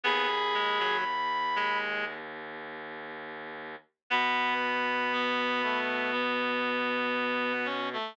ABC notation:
X:1
M:4/4
L:1/16
Q:1/4=59
K:G#phr
V:1 name="Clarinet"
b8 z8 | b8 z8 |]
V:2 name="Clarinet"
G4 z12 | B,2 z2 B,2 A,2 B,6 C A, |]
V:3 name="Clarinet"
B, z G, F, z2 G,2 z8 | B,16 |]
V:4 name="Clarinet" clef=bass
D,,16 | B,,16 |]